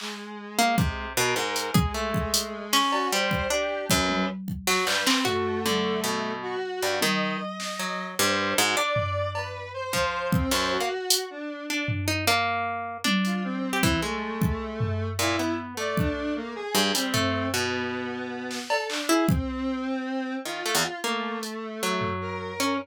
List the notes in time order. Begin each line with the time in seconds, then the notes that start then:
0.00 G#3, clap
0.59 A#3
0.78 C3, kick
1.17 B2 A#4
1.36 G#2
1.56 closed hi-hat
1.74 G#3 G#4, kick
1.94 A3
2.14 kick
2.34 closed hi-hat
2.73 C#4, snare
2.92 F#4, cowbell
3.12 G3 C5
3.31 kick
3.50 D4 G4
3.90 F#2 B4, kick
4.09 high tom
4.48 kick
4.67 F#3, snare
4.87 G2 B4, clap
5.06 C4, clap
5.25 A3 F#4, floor tom
5.65 D3, high tom
6.04 B2
6.43 F#4
6.82 G2
7.01 D#3 D#5, high tom
7.60 snare
7.79 F#3
8.18 G2 C5
8.57 G#2 F#4
8.76 D4 D5, cowbell
8.96 floor tom
9.35 B4, cowbell
9.74 C5
9.93 F3, kick
10.32 C4, kick
10.51 F#2 C5, clap
10.71 F#4
10.80 A#3
11.10 closed hi-hat
11.30 D4
11.69 D4
11.88 floor tom
12.08 D#4
12.27 A#3, cowbell
13.04 D4, high tom
13.25 F4, closed hi-hat
13.44 C4
13.73 G4
13.83 E3, kick
14.02 G#3 A3
14.42 kick
14.81 floor tom
15.19 A#2 E4
15.39 B3
15.77 A3 D5
15.97 D4, kick
16.36 A#3
16.56 G#4
16.75 G2
16.95 G3 C4, closed hi-hat
17.14 A3, floor tom
17.53 B2 B3
18.51 snare
18.70 A4, cowbell
18.89 D4, clap
19.09 E4 G#4
19.29 C4, kick
20.45 D#3 F4
20.66 A3
20.75 E2
21.04 A3 A#3
21.43 closed hi-hat
21.83 F#3
22.01 floor tom
22.21 A#4
22.60 C#4